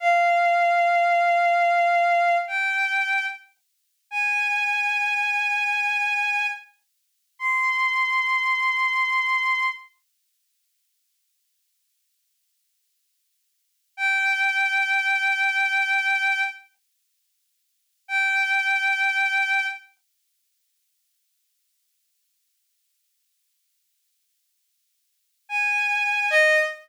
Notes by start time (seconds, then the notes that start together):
0.00 F5
2.47 G5
4.11 G#5
7.39 C6
13.97 G5
18.08 G5
25.49 G#5
26.30 D#5